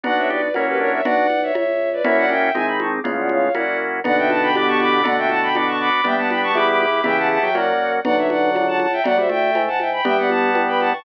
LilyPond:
<<
  \new Staff \with { instrumentName = "Violin" } { \time 2/2 \key b \minor \tempo 2 = 120 <d'' fis''>8 <cis'' e''>8 <b' d''>4 <ais' cis''>8 <g' b'>8 <ais' cis''>8 <cis'' e''>8 | <d'' fis''>4. <cis'' e''>8 <cis'' e''>4. <b' d''>8 | <cis'' e''>8 <d'' fis''>8 <e'' g''>4 <e'' gis''>8 b''8 <a'' cis'''>8 d'''8 | <cis'' eis''>8 <d'' fis''>8 <cis'' eis''>4 <d'' fis''>4 r4 |
<d'' fis''>8 <e'' g''>8 <fis'' a''>8 <g'' b''>8 <b'' d'''>8 <a'' cis'''>8 <b'' d'''>4 | <d'' fis''>8 <e'' g''>8 <fis'' a''>8 <g'' b''>8 <b'' d'''>8 <a'' cis'''>8 <b'' d'''>4 | <e'' g''>8 <fis'' a''>8 <g'' b''>8 <a'' cis'''>8 <b'' d'''>8 <b'' d'''>8 <b'' d'''>4 | <e'' g''>8 <fis'' a''>8 <fis'' a''>8 <e'' g''>8 <d'' fis''>4. r8 |
<d'' fis''>8 <cis'' e''>8 <d'' fis''>4. <fis'' a''>8 <fis'' a''>8 <e'' g''>8 | <d'' fis''>8 <c'' e''>8 <e'' g''>4. <fis'' a''>8 <e'' g''>8 <g'' b''>8 | <e'' g''>8 <d'' fis''>8 <fis'' a''>4. <g'' b''>8 <fis'' a''>8 <a'' cis'''>8 | }
  \new Staff \with { instrumentName = "Drawbar Organ" } { \time 2/2 \key b \minor <d' fis'>4 g'8 r8 cis'4 d'4 | <d' fis'>4 r2. | <cis' e'>4 cis'4 dis2 | <a, cis>2 r2 |
<b, d>1 | <b, d>1 | <g b>1 | <cis e>4. fis4. r4 |
<d fis>1 | fis8 g8 a2 r4 | <g b>1 | }
  \new Staff \with { instrumentName = "Drawbar Organ" } { \time 2/2 \key b \minor <b d' fis'>2 <ais cis' e' fis'>2 | r1 | <ais cis' e' fis'>2 <gis bis dis'>2 | <gis b cis' eis'>2 <ais cis' e' fis'>2 |
<b d' fis'>2 <b d' g'>2 | <a d' fis'>2 <b d' fis'>2 | <b d' g'>2 <b e' g'>2 | <b e' g'>2 <ais cis' fis'>2 |
r1 | r1 | r1 | }
  \new Staff \with { instrumentName = "Drawbar Organ" } { \clef bass \time 2/2 \key b \minor b,,2 fis,2 | b,,2 cis,2 | fis,2 gis,,2 | cis,2 fis,2 |
b,,2 g,,2 | r1 | g,,2 e,2 | e,2 fis,2 |
b,,2 cis,2 | d,2 gis,2 | g,,2 g,2 | }
  \new DrumStaff \with { instrumentName = "Drums" } \drummode { \time 2/2 <cgl cb>4 cgho4 <cgho cb>2 | <cgl cb>4 cgho4 <cgho cb>2 | <cgl cb>4 cgho4 <cgho cb>4 cgho4 | <cgl cb>4 cgho4 <cgho cb>2 |
<cgl cb>4 cgho4 <cgho cb>4 cgho4 | <cgl cb>4 cgho4 <cgho cb>2 | <cgl cb>4 cgho4 <cgho cb>4 cgho4 | <cgl cb>2 <cgho cb>2 |
<cgl cb>4 cgho4 <cgho cb>4 cgho4 | <cgl cb>4 cgho4 <cgho cb>4 cgho4 | <cgl cb>4 cgho4 <cgho cb>4 cgho4 | }
>>